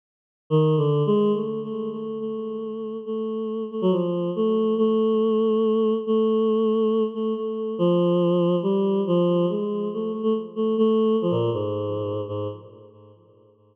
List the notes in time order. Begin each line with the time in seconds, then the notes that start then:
0.50 D#3
0.77 D3
1.06 G#3
1.34 A3
1.63 A3
1.92 A3
2.20 A3
3.06 A3
3.71 A3
3.82 F#3
3.92 F3
4.36 A3
4.78 A3
6.07 A3
7.14 A3
7.36 A3
7.78 F3
8.63 G3
9.07 F3
9.50 G#3
9.93 A3
10.12 A3
10.23 A3
10.56 A3
10.78 A3
11.22 F3
11.31 A#2
11.53 G#2
12.28 G#2